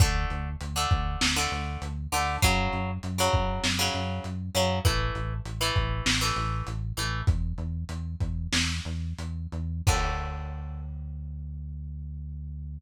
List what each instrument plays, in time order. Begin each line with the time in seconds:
0.00 synth bass 1 D2, acoustic guitar (steel) D3 A3, kick, closed hi-hat
0.30 synth bass 1 D2, closed hi-hat
0.61 synth bass 1 D2, closed hi-hat
0.76 acoustic guitar (steel) D3 A3
0.91 synth bass 1 D2, kick, closed hi-hat
1.21 synth bass 1 D2, snare
1.36 acoustic guitar (steel) D3 A3
1.52 synth bass 1 D2, closed hi-hat
1.82 synth bass 1 D2, closed hi-hat
2.12 synth bass 1 D2, acoustic guitar (steel) D3 A3, open hi-hat
2.42 synth bass 1 F#2, acoustic guitar (steel) C#3 F#3, kick, closed hi-hat
2.73 synth bass 1 F#2, closed hi-hat
3.03 synth bass 1 F#2, closed hi-hat
3.18 acoustic guitar (steel) C#3 F#3
3.33 synth bass 1 F#2, kick, closed hi-hat
3.64 synth bass 1 F#2, snare
3.79 acoustic guitar (steel) C#3 F#3
3.94 synth bass 1 F#2, closed hi-hat
4.24 synth bass 1 F#2, closed hi-hat
4.55 synth bass 1 F#2, acoustic guitar (steel) C#3 F#3, closed hi-hat
4.85 synth bass 1 A1, acoustic guitar (steel) E3 A3, kick, closed hi-hat
5.15 synth bass 1 A1, closed hi-hat
5.45 synth bass 1 A1, closed hi-hat
5.61 acoustic guitar (steel) E3 A3
5.76 synth bass 1 A1, kick, closed hi-hat
6.06 synth bass 1 A1, snare
6.21 acoustic guitar (steel) E3 A3
6.36 synth bass 1 A1, closed hi-hat
6.67 synth bass 1 A1, closed hi-hat
6.97 synth bass 1 A1, acoustic guitar (steel) E3 A3, closed hi-hat
7.27 synth bass 1 E2, kick, closed hi-hat
7.58 synth bass 1 E2, closed hi-hat
7.89 synth bass 1 E2, closed hi-hat
8.20 synth bass 1 E2, kick, closed hi-hat
8.53 synth bass 1 E2, snare
8.85 synth bass 1 E2, closed hi-hat
9.18 synth bass 1 E2, closed hi-hat
9.52 synth bass 1 E2, closed hi-hat
9.87 synth bass 1 D2, acoustic guitar (steel) D3 A3, kick, crash